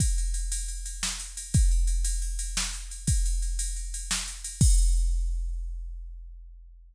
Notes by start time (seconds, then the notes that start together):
0.00 kick, ride
0.18 ride
0.34 ride
0.52 ride
0.68 ride
0.86 ride
1.03 snare
1.20 ride
1.37 ride
1.54 kick, ride
1.71 ride
1.87 ride
2.04 ride
2.22 ride
2.39 ride
2.57 snare
2.73 ride
2.91 ride
3.07 kick, ride
3.26 ride
3.42 ride
3.59 ride
3.76 ride
3.94 ride
4.11 snare
4.28 ride
4.44 ride
4.61 kick, crash